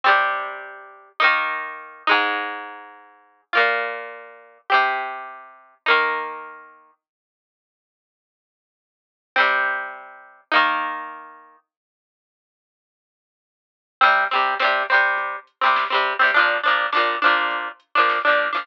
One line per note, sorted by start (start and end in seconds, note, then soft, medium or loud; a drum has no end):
0.04 1.09 C3 loud
0.04 1.09 G3 loud
0.04 1.09 C4 loud
1.20 2.03 A#3 loud
1.20 2.03 D#4 loud
1.24 2.03 D#3 loud
2.07 3.41 G#3 loud
2.07 3.41 D#4 loud
2.11 3.41 G#2 loud
3.53 4.58 A#2 loud
3.53 4.58 A#3 medium
3.53 4.58 F4 medium
4.70 5.75 C4 loud
4.70 5.75 G4 medium
4.74 5.75 C3 loud
5.86 6.91 A#3 loud
5.86 6.91 D#4 loud
5.90 6.91 D#3 loud
9.36 10.41 G3 medium
9.36 10.41 C4 loud
9.40 10.41 C3 medium
10.52 11.56 A#3 loud
10.52 11.56 D#4 loud
10.56 11.56 D#3 loud
14.01 14.24 G3 loud
14.01 14.24 C4 loud
14.01 kick loud
14.01 crash loud
14.05 14.24 C3 loud
14.31 14.55 G3 medium
14.31 14.55 C4 medium
14.31 closed hi-hat medium
14.35 14.55 C3 medium
14.59 14.83 G3 medium
14.59 14.83 C4 medium
14.59 snare loud
14.64 14.83 C3 medium
14.89 15.36 G3 medium
14.89 15.36 C4 medium
14.89 closed hi-hat medium
14.94 15.36 C3 medium
15.18 kick loud
15.18 closed hi-hat loud
15.47 closed hi-hat medium
15.61 15.85 G3 medium
15.61 15.85 C4 medium
15.65 15.85 C3 medium
15.76 snare loud
15.90 16.14 G3 medium
15.90 16.14 C4 medium
15.94 16.14 C3 medium
16.06 closed hi-hat medium
16.19 16.31 C3 medium
16.19 16.31 G3 medium
16.19 16.31 C4 medium
16.34 16.58 F3 loud
16.34 16.58 D4 loud
16.34 kick loud
16.34 closed hi-hat loud
16.38 16.58 A#2 loud
16.63 16.87 F3 medium
16.63 16.87 D4 medium
16.63 closed hi-hat medium
16.67 16.87 A#2 medium
16.92 17.16 F3 medium
16.92 17.16 D4 medium
16.92 snare loud
16.97 17.16 A#2 medium
17.22 17.69 F3 medium
17.22 17.69 D4 medium
17.22 closed hi-hat medium
17.26 17.69 A#2 loud
17.51 kick loud
17.51 closed hi-hat loud
17.80 closed hi-hat loud
17.95 18.19 A#2 medium
17.95 18.19 F3 medium
17.95 18.19 D4 medium
18.09 snare loud
18.25 18.48 F3 medium
18.25 18.48 D4 medium
18.29 18.48 A#2 medium
18.39 closed hi-hat medium
18.53 18.64 A#2 medium
18.53 18.64 F3 medium
18.53 18.64 D4 medium